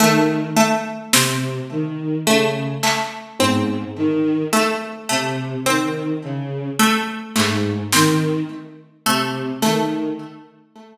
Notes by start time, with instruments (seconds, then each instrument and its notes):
0.00 violin D#3, harpsichord A3
0.56 harpsichord A3
1.13 violin C3, harpsichord C4, snare
1.70 violin D#3
2.26 violin C#3, harpsichord A3
2.83 harpsichord A3, clap
3.40 violin G#2, harpsichord C4, high tom
3.96 violin D#3
4.53 harpsichord A3
5.09 violin C3, harpsichord A3
5.66 violin D#3, harpsichord C4
6.23 violin C#3
6.79 harpsichord A3
7.36 violin G#2, harpsichord A3, clap
7.92 violin D#3, harpsichord C4, snare
9.06 violin C3, harpsichord A3
9.62 violin D#3, harpsichord A3, snare